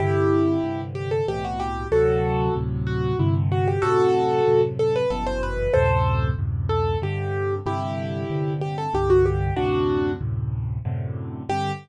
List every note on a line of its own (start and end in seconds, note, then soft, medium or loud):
0.00 0.57 G2 loud
0.00 0.57 C3 medium
0.00 0.57 D3 loud
0.00 0.81 E4 medium
0.00 0.81 G4 medium
0.64 1.21 G2 medium
0.64 1.21 C3 medium
0.64 1.21 D3 medium
0.95 1.10 G4 medium
1.11 1.26 A4 medium
1.28 1.86 C2 medium
1.28 1.86 A2 medium
1.28 1.86 B2 medium
1.28 1.86 E3 medium
1.28 1.43 G4 medium
1.45 1.60 F#4 medium
1.60 1.88 G4 medium
1.91 2.49 D2 loud
1.91 2.49 A2 medium
1.91 2.49 C3 loud
1.91 2.49 F#3 loud
1.91 2.54 F#4 medium
1.91 2.54 A4 medium
2.55 3.13 D2 medium
2.55 3.13 A2 medium
2.55 3.13 C3 medium
2.55 3.13 F#3 medium
2.87 3.18 F#4 medium
3.19 3.77 G2 loud
3.19 3.77 C3 loud
3.19 3.77 D3 medium
3.19 3.35 E4 medium
3.52 3.67 F#4 medium
3.68 3.83 G4 medium
3.82 4.40 F#2 medium
3.82 4.40 A2 medium
3.82 4.40 C3 loud
3.82 4.61 F#4 medium
3.82 4.61 A4 medium
4.47 5.04 F#2 medium
4.47 5.04 A2 medium
4.47 5.04 C3 medium
4.79 4.94 A4 medium
4.96 5.11 B4 medium
5.10 5.68 G1 loud
5.10 5.68 F#2 loud
5.10 5.68 B2 loud
5.10 5.68 E3 medium
5.10 5.26 A4 medium
5.27 5.42 C5 medium
5.43 5.73 B4 medium
5.74 6.32 D2 medium
5.74 6.32 F#2 medium
5.74 6.32 A2 loud
5.74 6.32 C3 loud
5.74 6.28 A4 medium
5.74 6.28 C5 medium
6.38 6.96 D2 medium
6.38 6.96 F#2 medium
6.38 6.96 A2 medium
6.38 6.96 C3 medium
6.69 6.98 A4 medium
7.02 7.59 G2 loud
7.02 7.59 C3 medium
7.02 7.59 D3 loud
7.02 7.55 G4 medium
7.66 8.23 G2 loud
7.66 8.23 C3 medium
7.66 8.23 D3 loud
7.66 8.53 E4 medium
7.66 8.53 G4 medium
8.30 8.87 G2 medium
8.30 8.87 C3 medium
8.30 8.87 D3 medium
8.61 8.77 G4 medium
8.78 8.93 A4 medium
8.93 9.51 C2 loud
8.93 9.51 G2 loud
8.93 9.51 D3 loud
8.93 9.10 G4 medium
9.10 9.25 F#4 medium
9.26 9.54 G4 medium
9.56 10.15 D2 medium
9.56 10.15 F#2 medium
9.56 10.15 A2 loud
9.56 10.15 C3 loud
9.56 10.11 D4 medium
9.56 10.11 F#4 medium
10.21 10.78 D2 medium
10.21 10.78 F#2 medium
10.21 10.78 A2 medium
10.21 10.78 C3 medium
10.85 11.43 F#2 medium
10.85 11.43 A2 medium
10.85 11.43 C3 loud
10.85 11.43 D3 loud
11.49 11.71 G2 loud
11.49 11.71 C3 loud
11.49 11.71 D3 loud
11.49 11.72 G4 loud